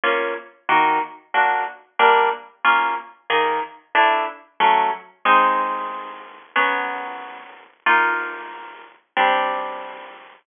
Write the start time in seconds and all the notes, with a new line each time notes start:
0.04 A#3 C#4 F4
0.69 D#3 A#3 F#4
1.34 A#3 D4 F#4
1.99 G3 A#3 D4
2.64 A#3 C#4 F4
3.30 D#3 A#3 G#4
3.95 A3 D4 E4
4.60 F#3 A3 C#4
5.25 G#3 C4 D#4
6.56 F#3 B3 C#4
7.86 A#3 D#4 F4
9.17 G3 C4 D4